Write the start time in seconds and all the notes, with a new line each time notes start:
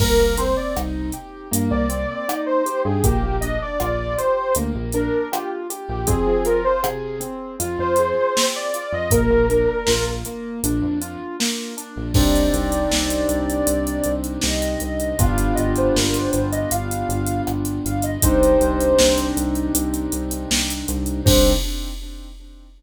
0.00 C2 A#3 A#4, kick, crash
0.19 C2
0.38 C4 C5, closed hi-hat
0.57 D5
0.76 C2 D#4, cross-stick
1.12 G4, closed hi-hat
1.51 G2 A#3, closed hi-hat
1.71 C2 D5
1.89 C4, closed hi-hat
2.28 D#4, cross-stick
2.46 C5
2.66 G4, closed hi-hat
2.85 G2 G#4
3.03 A#1 A#3 G4, kick, closed hi-hat
3.23 A#1
3.41 D4 D#5, closed hi-hat
3.62 D5
3.80 A#1 F4 D5, cross-stick
4.18 G4 C5, closed hi-hat
4.55 D2 A#3, closed hi-hat
4.75 A#1
4.92 D4 A#4, closed hi-hat
5.32 F4 G4, cross-stick
5.70 G4, closed hi-hat
5.89 A#1 G4
6.07 F2 C4 G#4, kick, closed hi-hat
6.27 F3
6.45 F4 A#4, closed hi-hat
6.64 C5
6.83 C3 G#4, cross-stick
7.20 C4, closed hi-hat
7.60 F2 F4, closed hi-hat
7.78 F2 C5
7.96 G#4, closed hi-hat
8.35 C4, snare
8.56 D5
8.74 F4, closed hi-hat
8.92 F2 D#5
9.11 A#1 A#3 A#4, kick, closed hi-hat
9.30 A#1
9.49 D4, closed hi-hat
9.87 A#1 F4, snare
10.25 A#3, closed hi-hat
10.63 A#1 D4, closed hi-hat
10.82 F2
11.01 F4, closed hi-hat
11.40 A#3, snare
11.77 D4, closed hi-hat
11.96 A#1
12.14 C2 C4 D4 D#4 G4 D5, kick, crash
12.35 closed hi-hat
12.53 C2, closed hi-hat
12.72 closed hi-hat
12.91 C2, snare
13.10 closed hi-hat
13.29 C2, closed hi-hat
13.50 closed hi-hat
13.67 C2, closed hi-hat
13.87 closed hi-hat
14.04 C2, closed hi-hat
14.24 closed hi-hat
14.41 C2 D#5, snare
14.62 closed hi-hat
14.80 C2, closed hi-hat
15.00 closed hi-hat
15.19 G1 B3 D4 F4 G4 F5, kick, closed hi-hat
15.38 F5, closed hi-hat
15.55 G1 D#5, closed hi-hat
15.76 C5, closed hi-hat
15.95 G1 A#4, snare
16.14 C5, closed hi-hat
16.31 G1 C5, closed hi-hat
16.52 D#5, closed hi-hat
16.71 G1 F5, closed hi-hat
16.91 closed hi-hat
17.09 G1, closed hi-hat
17.26 closed hi-hat
17.47 G1, cross-stick
17.65 closed hi-hat
17.85 G1 F5, closed hi-hat
18.02 D#5, closed hi-hat
18.22 C2 C4 D4 D#4 G4 C5, kick, closed hi-hat
18.43 closed hi-hat
18.61 C2, closed hi-hat
18.81 closed hi-hat
18.99 C2, snare
19.18 closed hi-hat
19.37 C2, closed hi-hat
19.55 closed hi-hat
19.75 C2, closed hi-hat
19.94 closed hi-hat
20.12 C2, closed hi-hat
20.31 closed hi-hat
20.51 C2, snare
20.70 closed hi-hat
20.88 C2, closed hi-hat
21.06 closed hi-hat
21.25 C2 C4 D4 D#4 G4 C5, kick, crash